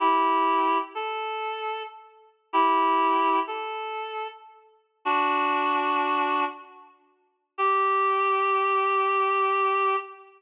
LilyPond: \new Staff { \time 4/4 \key g \dorian \tempo 4 = 95 <e' g'>4. a'4. r4 | <e' g'>4. a'4. r4 | <d' fis'>2~ <d' fis'>8 r4. | g'1 | }